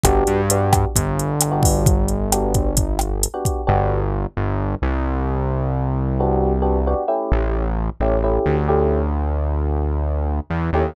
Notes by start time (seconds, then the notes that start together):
0.04 G1 B3 D4 F#4 G4, kick, cross-stick, closed hi-hat
0.27 G2, closed hi-hat
0.50 B3 D4 F#4 G4, closed hi-hat
0.73 kick, cross-stick, closed hi-hat
0.95 G1, kick, closed hi-hat
1.19 closed hi-hat
1.41 cross-stick, closed hi-hat
1.52 B3 D4 F#4 G4
1.63 kick, open hi-hat
1.86 kick, closed hi-hat
2.08 closed hi-hat
2.32 B3 D4 F#4 G4, cross-stick, closed hi-hat
2.54 kick, closed hi-hat
2.77 kick, closed hi-hat
2.99 cross-stick, closed hi-hat
3.23 closed hi-hat
3.34 B3 D4 F#4 G4
3.45 kick, closed hi-hat
3.67 G1 B3 D4 F#4 G4
4.37 G1
4.82 C2
6.20 B3 D4 F#4 G4
6.62 B3 D4 F#4 G4
6.87 B3 D4 F#4 G4
7.08 A3 C#4 E4 G4
7.32 A1
8.00 A1 A3 C#4 E4 G4
8.24 A3 C#4 E4 G4
8.46 D2
8.68 A3 C#4 E4 G4
10.50 E2
10.73 D#2 A3 C#4 E4 G4